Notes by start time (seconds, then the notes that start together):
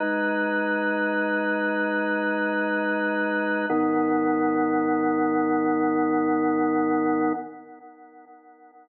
0.00 G#3 D#4 B4
3.69 G#2 D#3 B3